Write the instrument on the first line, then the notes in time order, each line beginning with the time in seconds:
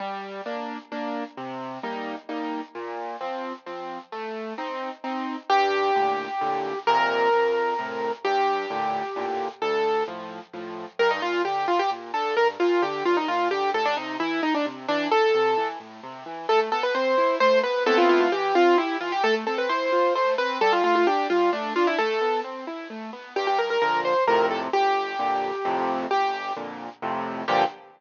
acoustic grand piano
0.00 G3
0.46 A#3 D4
0.92 A#3 D4
1.37 C3
1.83 G3 A#3 D#4
2.29 G3 A#3 D#4
2.75 A#2
3.21 F3 C4
3.66 F3 C4
4.12 A3
4.58 C4 D#4
5.04 C4 D#4
5.50 G2 G4
5.95 A2 A#2 D3
6.41 A2 A#2 D3
6.87 F2 A#2 C3 A#4
7.33 F2
7.79 A2 C3
8.25 G2 G4
8.70 A2 A#2 D3
9.16 A2 A#2 D3
9.62 D2 A4
10.08 A2 F3
10.53 A2 F3
10.99 G2 A#4
11.11 D#4
11.22 A#2 F4
11.45 D3 G4
11.68 G2 F4
11.79 G4
11.91 A#2
12.14 D3 A4
12.37 G2 A#4
12.60 A#2 F4
12.82 D3 G4
13.05 G2 F4
13.17 D#4
13.28 A#2 F4
13.51 D3 G4
13.74 A2 A4
13.85 D4
13.97 C3 D#4
14.20 E3 E4
14.43 A2 D#4
14.54 D4
14.66 C3
14.88 E3 D4
15.11 A2 A4
15.34 C3
15.57 E3
15.80 A2
16.03 C3
16.26 E3
16.49 A3 A4
16.72 B3 A4
16.83 B4
16.95 C4 C5
17.18 E4
17.40 A3 C5
17.63 B3 B4
17.86 A3 B3 C4 E4 A4
17.98 F4
18.09 F4
18.21 F4
18.32 E3 G4
18.55 C4 F4
18.78 E4 G4
19.01 E3 F4
19.12 G4
19.24 A3 A4
19.47 C4 A4
19.58 B4
19.69 E4 C5
19.92 F4
20.15 A3 C5
20.38 C4 B4
20.61 G3 A4
20.73 F4
20.84 A3 F4
20.95 F4
21.07 D4 G4
21.30 G3 F4
21.53 A3 D4
21.75 D4 F4
21.87 E4
21.98 A3 A4
22.21 B3
22.44 C4
22.67 E4
22.90 A3
23.13 B3
23.36 G2 G4
23.47 G4
23.59 A#4
23.70 A#4
23.82 A#2 D3 F3 A#4
24.05 C5
24.27 F2 A2 C3 A#4
24.51 A4
24.73 G1 G4
25.19 F2 A#2 D3
25.65 F2 A2 C3
26.11 G1 G4
26.56 F2 A#2 D3
27.02 F2 A2 C3
27.48 G2 A#2 D3 F3 G4